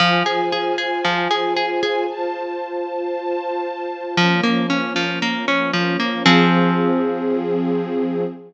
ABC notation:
X:1
M:4/4
L:1/8
Q:1/4=115
K:Fm
V:1 name="Orchestral Harp"
F, A A A F, A A A | z8 | F, B, D F, B, D F, B, | [F,CA]8 |]
V:2 name="String Ensemble 1"
[Fca]8 | [Fc=a]8 | [F,B,D]8 | [F,CA]8 |]